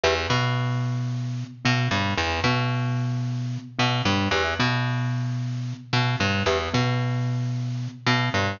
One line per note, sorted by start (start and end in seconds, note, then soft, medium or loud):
0.03 0.27 E2 loud
0.03 0.14 G4 medium
0.03 0.14 B4 medium
0.03 0.14 E5 medium
0.30 1.44 B2 medium
0.30 1.44 B3 medium
1.65 1.88 B2 medium
1.65 1.87 B3 medium
1.91 2.14 G2 medium
1.91 2.14 G3 medium
2.18 2.40 E2 loud
2.44 3.58 B2 medium
2.44 3.59 B3 medium
3.79 4.02 B2 medium
3.79 4.01 B3 medium
4.05 4.28 G2 medium
4.05 4.28 G3 medium
4.31 4.54 E2 loud
4.31 4.43 G4 medium
4.31 4.43 B4 medium
4.31 4.43 E5 medium
4.59 5.73 B2 medium
4.59 5.73 B3 medium
5.93 6.16 B2 medium
5.93 6.16 B3 medium
6.20 6.43 G2 medium
6.20 6.43 G3 medium
6.46 6.69 E2 medium
6.46 6.58 G4 medium
6.46 6.58 B4 medium
6.46 6.58 E5 medium
6.74 7.88 B2 medium
6.74 7.87 B3 medium
8.06 8.29 B2 medium
8.06 8.30 B3 medium
8.34 8.57 G2 medium
8.34 8.57 G3 medium